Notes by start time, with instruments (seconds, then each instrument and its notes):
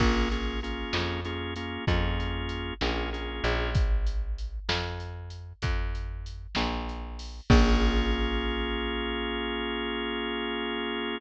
0.00 electric bass (finger) A#1, drawbar organ A#3 C#4 F4 G#4, kick, crash
0.31 drawbar organ A#3 C#4 F4 G#4, closed hi-hat
0.63 drawbar organ A#3 C#4 F4 G#4, closed hi-hat
0.93 electric bass (finger) F2, snare
1.25 drawbar organ A#3 C#4 F4 G#4, closed hi-hat
1.56 drawbar organ A#3 C#4 F4 G#4, closed hi-hat
1.87 electric bass (finger) F2, drawbar organ A#3 C#4 F4 G#4, kick, closed hi-hat
2.20 closed hi-hat
2.49 closed hi-hat
2.81 electric bass (finger) A#1, drawbar organ A#3 C#4 F4 G#4, snare
3.13 drawbar organ A#3 C#4 F4 G#4, closed hi-hat
3.44 electric bass (finger) A#1, closed hi-hat
3.75 kick, closed hi-hat
4.07 closed hi-hat
4.38 closed hi-hat
4.69 electric bass (finger) F2, snare
5.00 closed hi-hat
5.30 closed hi-hat
5.62 electric bass (finger) F2, kick, closed hi-hat
5.95 closed hi-hat
6.26 closed hi-hat
6.55 electric bass (finger) A#1, snare
6.89 closed hi-hat
7.19 open hi-hat
7.50 electric bass (finger) A#1, drawbar organ A#3 C#4 F4 G#4, kick, crash